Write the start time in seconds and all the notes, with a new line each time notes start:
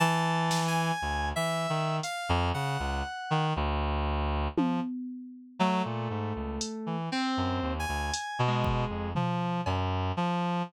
0.00 E3 A5
0.51 snare
0.68 G#5
1.02 D2
1.36 E3 E5
1.69 D#3
2.03 F5, closed hi-hat
2.29 F2
2.54 C#3 F#5
2.80 C#2
3.31 D#3
3.56 D2, cowbell
4.57 F3, high tom
5.59 F#3 A3
5.85 A#2
6.10 G#2
6.36 C#2
6.61 closed hi-hat
6.86 E3
7.12 C4
7.37 F#2
7.62 D#2
7.79 G#5
7.88 D2
8.14 closed hi-hat
8.39 B2
8.47 G#3
8.64 kick
8.90 F2
9.15 F3, floor tom
9.66 F#2, cowbell
10.17 F3